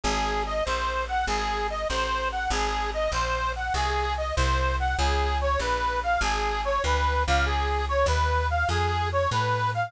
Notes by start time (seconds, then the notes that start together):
0.03 G#1 G#4
0.47 D#5
0.65 A#1 C5
1.08 F#5
1.27 G#1 G#4
1.70 D#5
1.89 A1 C5
2.32 F#5
2.50 G#1 G#4
2.94 D#5
3.12 A#1 C5
3.56 F#5
3.74 C2 G#4
4.18 D#5
4.36 C2 C5
4.80 F#5
4.98 C#2 G#4
5.41 C#5
5.59 A#1 B4
6.03 F5
6.21 G#1 G#4
6.65 C#5
6.84 D2 B4
7.27 C#2 F5
7.46 G#4
7.89 C#5
8.06 D#2 B4
8.51 F5
8.69 F2 G#4
9.12 C#5
9.31 A2 B4
9.74 F5